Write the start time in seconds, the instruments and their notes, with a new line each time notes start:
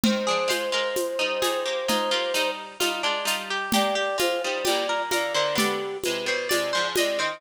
0.03 harpsichord D#3 C4, flute C5, low conga
0.27 harpsichord F3 D4 G#4
0.48 harpsichord G#3 F4 C5, high conga, shaker
0.72 harpsichord G#3 F4 A#4
0.96 high conga, shaker
1.19 harpsichord G3 D#4
1.42 harpsichord G3 D#4 G#4, high conga, shaker
1.66 harpsichord A#3 G4
1.88 harpsichord G#3 D#4 F4, low conga, shaker
2.11 harpsichord A#3 F4 G4
2.34 harpsichord G3 D#4, shaker
2.80 harpsichord G3 D#4 F4, high conga, shaker
3.03 harpsichord G#3 D4 F4
3.25 harpsichord G3 D#4 F4, shaker
3.50 harpsichord G4
3.72 harpsichord A#3 G4, flute D5, low conga, shaker
3.95 harpsichord G4
4.18 harpsichord G#3 F4, flute C5, high conga, shaker
4.43 harpsichord G3 D#4, flute C5
4.65 harpsichord A#2 G3 G4, flute D5, high conga, shaker
4.89 harpsichord A#4
5.11 harpsichord D3 A#3 A#4, flute D5, high conga, shaker
5.34 harpsichord D3 A#3 C5, flute D5
5.55 harpsichord D3 B3 D5, flute G4, low conga, shaker
6.03 harpsichord C3 G#3, flute B4, high conga, shaker
6.26 harpsichord B2 G3 C5, flute B4
6.49 harpsichord C3 G#3 D5, flute D5, high conga, shaker
6.73 harpsichord G#2 F3 C5
6.96 harpsichord C3 G#3 D#5, flute D5, high conga, shaker
7.19 harpsichord D#3 C4 C5, flute D#5